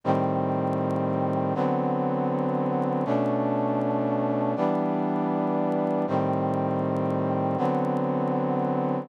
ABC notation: X:1
M:4/4
L:1/8
Q:1/4=159
K:G
V:1 name="Brass Section"
[A,,_E,G,C]8 | [D,F,B,C]8 | [B,,A,^CD]8 | [E,G,B,D]8 |
[A,,_E,G,C]8 | [D,F,B,C]8 |]